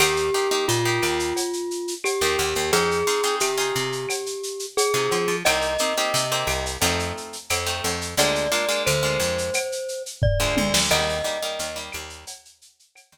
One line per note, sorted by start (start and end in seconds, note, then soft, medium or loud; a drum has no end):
0.00 0.30 D#2 medium
0.00 0.27 A#3 loud
0.00 0.27 D#4 loud
0.00 0.27 G4 loud
0.00 0.66 G4 loud
0.00 cowbell medium
0.00 claves loud
0.00 shaker loud
0.16 shaker medium
0.34 0.48 A#3 medium
0.34 0.48 D#4 loud
0.34 0.48 G4 medium
0.34 shaker medium
0.51 0.78 A#3 loud
0.51 0.78 D#4 loud
0.51 0.78 G4 loud
0.51 shaker medium
0.68 0.99 A#2 medium
0.68 1.94 F4 loud
0.68 shaker medium
0.85 1.40 A#3 loud
0.85 1.40 D#4 loud
0.85 1.40 G4 medium
0.85 shaker medium
1.02 1.34 D#2 medium
1.02 claves medium
1.02 shaker medium
1.19 shaker medium
1.36 cowbell medium
1.36 shaker medium
1.53 shaker medium
1.71 shaker medium
1.88 shaker medium
2.04 2.71 G4 loud
2.04 cowbell medium
2.04 claves medium
2.04 shaker medium
2.21 2.37 D#2 medium
2.21 2.63 A#3 medium
2.21 2.63 D#4 medium
2.21 2.63 G4 loud
2.21 shaker medium
2.38 2.54 D#2 medium
2.38 cowbell medium
2.38 shaker medium
2.55 2.71 D#2 medium
2.55 shaker medium
2.72 3.04 F2 medium
2.72 3.00 C4 loud
2.72 3.00 D#4 loud
2.72 3.00 F4 loud
2.72 3.35 G#4 loud
2.72 3.00 G#4 loud
2.72 cowbell medium
2.72 shaker medium
2.91 shaker medium
3.07 3.21 C4 loud
3.07 3.21 D#4 loud
3.07 3.21 F4 loud
3.07 3.21 G#4 loud
3.07 shaker medium
3.23 3.51 C4 medium
3.23 3.51 D#4 loud
3.23 3.51 F4 medium
3.23 3.51 G#4 loud
3.23 shaker medium
3.40 3.72 C3 medium
3.40 4.66 G4 medium
3.40 claves medium
3.40 shaker medium
3.58 4.12 C4 loud
3.58 4.12 D#4 loud
3.58 4.12 F4 loud
3.58 4.12 G#4 loud
3.58 shaker medium
3.75 4.06 C3 medium
3.75 shaker medium
3.92 shaker medium
4.09 cowbell medium
4.09 claves medium
4.09 shaker medium
4.26 shaker medium
4.43 shaker medium
4.59 shaker medium
4.77 5.36 G#4 loud
4.77 cowbell medium
4.77 shaker loud
4.94 5.09 C3 medium
4.94 5.35 C4 loud
4.94 5.35 D#4 medium
4.94 5.35 F4 medium
4.94 5.35 G#4 medium
4.94 shaker medium
5.11 5.27 F3 medium
5.11 cowbell medium
5.11 shaker medium
5.28 5.43 F3 medium
5.28 shaker medium
5.45 5.77 C2 medium
5.45 5.73 A#3 loud
5.45 5.73 C4 loud
5.45 5.73 D#4 loud
5.45 5.73 G4 loud
5.45 6.66 D#5 loud
5.45 cowbell medium
5.45 claves loud
5.45 shaker medium
5.61 shaker medium
5.78 5.93 A#3 medium
5.78 5.93 C4 loud
5.78 5.93 D#4 loud
5.78 5.93 G4 loud
5.78 shaker medium
5.97 6.25 A#3 loud
5.97 6.25 C4 medium
5.97 6.25 D#4 loud
5.97 6.25 G4 loud
5.97 shaker medium
6.14 6.45 C3 medium
6.14 shaker loud
6.31 6.73 A#3 loud
6.31 6.73 C4 loud
6.31 6.73 D#4 loud
6.31 6.73 G4 medium
6.31 shaker medium
6.47 6.78 C2 medium
6.47 claves medium
6.47 shaker medium
6.66 shaker medium
6.81 7.12 F2 loud
6.81 7.36 A3 loud
6.81 7.36 C4 loud
6.81 7.36 D#4 loud
6.81 7.36 F4 loud
6.81 cowbell medium
6.81 shaker medium
6.99 shaker medium
7.17 shaker medium
7.33 shaker medium
7.50 7.81 F2 medium
7.50 cowbell medium
7.50 claves medium
7.50 shaker medium
7.66 8.07 A3 medium
7.66 8.07 C4 medium
7.66 8.07 D#4 medium
7.66 8.07 F4 loud
7.66 shaker medium
7.84 8.15 F2 medium
7.84 cowbell medium
7.84 shaker medium
8.01 shaker medium
8.17 8.48 D2 medium
8.17 8.46 G#3 loud
8.17 8.46 A#3 loud
8.17 8.46 D4 loud
8.17 8.46 F4 loud
8.17 8.83 D5 loud
8.17 cowbell medium
8.17 shaker loud
8.35 shaker medium
8.52 8.65 G#3 loud
8.52 8.65 A#3 loud
8.52 8.65 D4 loud
8.52 8.65 F4 loud
8.52 shaker medium
8.69 8.96 G#3 loud
8.69 8.96 A#3 loud
8.69 8.96 D4 medium
8.69 8.96 F4 loud
8.69 shaker medium
8.86 9.18 D2 medium
8.86 10.03 C5 loud
8.86 claves medium
8.86 shaker medium
9.03 9.57 G#3 medium
9.03 9.57 A#3 medium
9.03 9.57 D4 medium
9.03 9.57 F4 loud
9.03 shaker medium
9.20 9.50 F2 medium
9.20 shaker medium
9.38 shaker medium
9.54 cowbell medium
9.54 claves medium
9.54 shaker medium
9.72 shaker medium
9.88 shaker medium
10.06 shaker medium
10.22 10.80 D5 medium
10.22 kick medium
10.22 floor tom medium
10.40 10.55 D2 medium
10.40 10.81 G#3 loud
10.40 10.81 A#3 loud
10.40 10.81 D4 medium
10.40 10.81 F4 loud
10.57 10.73 D2 medium
10.57 high tom medium
10.74 10.89 D2 medium
10.74 snare loud
10.91 11.22 D#2 loud
10.91 11.18 G3 loud
10.91 11.18 A#3 loud
10.91 11.18 D#4 loud
10.91 11.79 D#5 loud
10.91 crash loud
10.91 cowbell medium
10.91 claves medium
11.09 shaker medium
11.24 11.38 G3 loud
11.24 11.38 A#3 medium
11.24 11.38 D#4 medium
11.24 shaker medium
11.42 11.70 G3 loud
11.42 11.70 A#3 loud
11.42 11.70 D#4 loud
11.42 shaker medium
11.59 11.90 D#2 medium
11.59 shaker medium
11.76 12.31 G3 loud
11.76 12.31 A#3 medium
11.76 12.31 D#4 medium
11.76 shaker medium
11.92 12.25 D#2 medium
11.92 claves medium
11.92 shaker medium
12.10 shaker medium
12.27 cowbell medium
12.27 shaker loud
12.45 shaker medium
12.62 shaker medium
12.79 shaker medium
12.95 cowbell medium
12.95 claves medium
12.95 shaker medium
13.12 13.18 D#2 medium
13.12 13.18 G3 loud
13.12 13.18 A#3 loud
13.12 13.18 D#4 medium
13.12 shaker medium